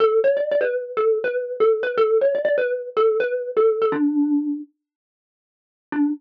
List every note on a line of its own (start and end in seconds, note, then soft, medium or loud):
0.00 0.19 A4 loud
0.24 0.36 C#5 loud
0.37 0.48 D5 medium
0.51 0.63 D5 loud
0.61 0.96 B4 medium
0.97 1.18 A4 medium
1.24 1.56 B4 loud
1.60 1.82 A4 medium
1.83 1.95 B4 loud
1.97 2.18 A4 loud
2.21 2.33 C#5 medium
2.35 2.44 D5 medium
2.45 2.56 D5 loud
2.58 2.90 B4 loud
2.97 3.17 A4 loud
3.20 3.51 B4 loud
3.57 3.79 A4 loud
3.82 3.93 A4 loud
3.92 4.59 D4 loud
5.92 6.09 D4 loud